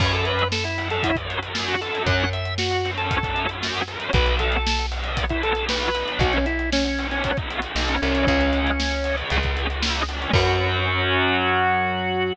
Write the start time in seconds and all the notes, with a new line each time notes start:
0.00 F#2 F#3 C#4 C#5, kick, crash
0.12 A4, closed hi-hat
0.25 B4, closed hi-hat
0.39 closed hi-hat
0.52 A4, snare
0.64 E4, closed hi-hat
0.78 F#3 C#4, closed hi-hat
0.90 A4, closed hi-hat
1.03 E4, kick, closed hi-hat
1.16 F#3 C#4, kick, closed hi-hat
1.30 closed hi-hat
1.42 F#3 C#4, closed hi-hat
1.55 snare
1.68 F#4, closed hi-hat
1.81 F#3 C#4 A4, closed hi-hat
1.95 closed hi-hat
2.06 F#2 F#5, kick, closed hi-hat
2.20 closed hi-hat
2.33 E5, closed hi-hat
2.45 closed hi-hat
2.58 F#4, snare
2.71 closed hi-hat
2.85 F#3 C#4, closed hi-hat
2.97 A4, closed hi-hat
3.11 kick, closed hi-hat
3.23 F#3 C#4, kick, closed hi-hat
3.36 closed hi-hat
3.49 F#3 C#4, closed hi-hat
3.62 snare, closed hi-hat
3.75 closed hi-hat
3.88 F#3 C#4, closed hi-hat
4.00 closed hi-hat
4.13 B1 F#3 B3 B4, kick, closed hi-hat
4.26 closed hi-hat
4.39 A4, closed hi-hat
4.52 closed hi-hat
4.67 snare
4.79 closed hi-hat
4.91 F#3 B3, closed hi-hat
5.04 closed hi-hat
5.17 kick, closed hi-hat
5.29 F#3 B3 E4, kick, closed hi-hat
5.43 A4, closed hi-hat
5.55 F#3 B3, closed hi-hat
5.69 B4, snare
5.82 closed hi-hat
5.95 F#3 B3, closed hi-hat
6.08 closed hi-hat
6.19 B1 F#4, kick, closed hi-hat
6.33 C#4, closed hi-hat
6.46 E4, closed hi-hat
6.59 closed hi-hat
6.72 C#4, snare
6.85 C#4, closed hi-hat
6.99 F#3 B3, closed hi-hat
7.11 C#4, closed hi-hat
7.24 C#4, kick, closed hi-hat
7.37 F#3 B3, kick, closed hi-hat
7.50 closed hi-hat
7.62 F#3 B3, closed hi-hat
7.76 B1, snare
7.88 C#4, closed hi-hat
8.02 C2 F#3 B3 C#4, closed hi-hat
8.15 closed hi-hat
8.27 C#2 G#3 C#4, kick, closed hi-hat
8.41 closed hi-hat
8.53 closed hi-hat
8.67 closed hi-hat
8.80 snare
8.91 closed hi-hat
9.04 G#3 C#4, closed hi-hat
9.18 closed hi-hat
9.30 C#2, kick, closed hi-hat
9.43 G#3 C#4, kick, closed hi-hat
9.57 closed hi-hat
9.70 G#3 C#4, closed hi-hat
9.82 snare
9.95 closed hi-hat
10.08 G#3 C#4, closed hi-hat
10.22 closed hi-hat
10.33 F#2 F#3 C#4 F#4, kick, closed hi-hat, crash